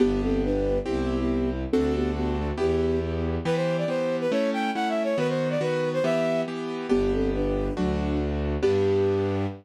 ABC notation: X:1
M:2/4
L:1/16
Q:1/4=139
K:G
V:1 name="Flute"
[B,G]2 [CA]2 [DB]4 | [B,G]3 [B,G]3 z2 | [CA]2 [B,G]2 [B,G]2 [A,F] z | [B,G]4 z4 |
[K:Em] z8 | z8 | z8 | z8 |
[K:G] [B,G]2 [CA]2 [DB]4 | [F,D]4 z4 | G8 |]
V:2 name="Violin"
z8 | z8 | z8 | z8 |
[K:Em] B c2 d c3 B | ^c2 g2 (3f2 e2 c2 | B c2 d B3 c | e4 z4 |
[K:G] z8 | z8 | z8 |]
V:3 name="Acoustic Grand Piano"
[B,DG]8 | [CEG]8 | [CDFA]8 | [B,EG]8 |
[K:Em] [E,B,G]4 [E,B,G]4 | [A,^CE]4 [A,CE]4 | [^D,B,F]4 [D,B,F]4 | [E,B,G]4 [E,B,G]4 |
[K:G] [B,DG]8 | [A,DF]8 | [B,DG]8 |]
V:4 name="Violin" clef=bass
G,,,8 | C,,8 | D,,8 | E,,8 |
[K:Em] z8 | z8 | z8 | z8 |
[K:G] G,,,8 | D,,8 | G,,8 |]